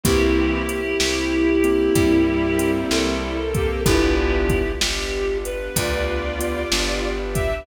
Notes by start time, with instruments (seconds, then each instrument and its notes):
0.03 electric bass (finger) C2, violin E3 C4, string ensemble 1 A#3 C4 E4 G4, acoustic grand piano A#3 C4 E4 G4, clarinet E4 G4, kick, closed hi-hat
0.69 closed hi-hat
1.00 electric bass (finger) C2, snare
1.64 acoustic grand piano A#3 C4 E4 G4, closed hi-hat
1.95 electric bass (finger) G2, violin G3 E4, string ensemble 1 A#3 C4 G4 A#4, kick, closed hi-hat
2.59 acoustic grand piano A#3 C4 E4 G4, closed hi-hat
2.90 electric bass (finger) C2, clarinet A4, snare
3.54 violin A#3 G4, kick, closed hi-hat
3.85 electric bass (finger) G1, acoustic grand piano B3 D4 F4 G4, string ensemble 1 B3 D4 F4 G4, violin D4 B4, clarinet E4 G4, kick, closed hi-hat
4.49 kick, closed hi-hat
4.81 electric bass (finger) G1, clarinet G4, snare
5.45 clarinet B4, closed hi-hat
5.76 electric bass (finger) D2, string ensemble 1 B3 D4 G4 B4, violin F4 D5, kick, closed hi-hat
6.39 acoustic grand piano B3 D4 F4 G4, closed hi-hat
6.72 electric bass (finger) G1, acoustic grand piano B3 D4 F4 G4, snare
7.34 violin G4 E5, kick, closed hi-hat